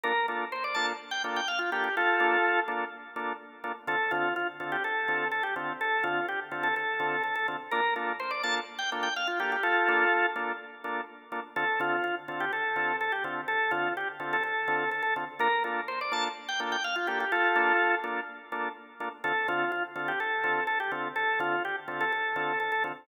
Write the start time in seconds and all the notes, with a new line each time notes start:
0.04 A#3 D4 F4 A4 A#4
0.28 A#3 D4 F4 A4
0.52 C5
0.64 D5
0.74 A#3 D4 F4 A4 A5
1.11 G5
1.24 A#3 D4 F4 A4
1.36 G5
1.48 F5
1.59 F4
1.72 A#3 D4 F4 G4 A4
1.84 G4
1.97 F4 A4
2.20 A#3 D4 F4 A4
2.68 A#3 D4 F4 A4
3.16 A#3 D4 F4 A4
3.64 A#3 D4 F4 A4
3.87 D3 C4 F4 A4
4.11 D3 C4 F4 A4
4.36 F4
4.60 D3 C4 F4 A4
4.72 G4
4.84 A4
5.08 D3 C4 F4 A4
5.32 A4
5.43 G4
5.56 D3 C4 F4 A4
5.81 A4
6.04 D3 C4 F4 A4
6.29 G4
6.52 D3 C4 F4 A4
6.63 A4
6.76 A4
7.00 D3 C4 F4 A4
7.24 A4
7.36 A4
7.48 D3 C4 F4 A4
7.71 A#3 D4 F4 A4 A#4
7.96 A#3 D4 F4 A4
8.20 C5
8.31 D5
8.43 A#3 D4 F4 A4 A5
8.79 G5
8.92 A#3 D4 F4 A4
9.03 G5
9.16 F5
9.27 F4
9.39 A#3 D4 F4 G4 A4
9.52 G4
9.63 F4 A4
9.88 A#3 D4 F4 A4
10.36 A#3 D4 F4 A4
10.84 A#3 D4 F4 A4
11.32 A#3 D4 F4 A4
11.56 D3 C4 F4 A4
11.80 D3 C4 F4 A4
12.04 F4
12.28 D3 C4 F4 A4
12.40 G4
12.53 A4
12.76 D3 C4 F4 A4
13.01 A4
13.12 G4
13.24 D3 C4 F4 A4
13.48 A4
13.71 D3 C4 F4 A4
13.97 G4
14.20 D3 C4 F4 A4
14.33 A4
14.43 A4
14.68 D3 C4 F4 A4
14.91 A4
15.03 A4
15.16 D3 C4 F4 A4
15.39 A#3 D4 F4 A4 A#4
15.64 A#3 D4 F4 A4
15.88 C5
16.01 D5
16.12 A#3 D4 F4 A4 A5
16.48 G5
16.60 A#3 D4 F4 A4
16.72 G5
16.84 F5
16.96 F4
17.07 A#3 D4 F4 G4 A4
17.20 G4
17.32 F4 A4
17.56 A#3 D4 F4 A4
18.04 A#3 D4 F4 A4
18.52 A#3 D4 F4 A4
19.00 A#3 D4 F4 A4
19.24 D3 C4 F4 A4
19.48 D3 C4 F4 A4
19.72 F4
19.96 D3 C4 F4 A4
20.08 G4
20.20 A4
20.44 D3 C4 F4 A4
20.67 A4
20.80 G4
20.91 D3 C4 F4 A4
21.16 A4
21.39 D3 C4 F4 A4
21.65 G4
21.88 D3 C4 F4 A4
22.01 A4
22.12 A4
22.36 D3 C4 F4 A4
22.60 A4
22.72 A4
22.84 D3 C4 F4 A4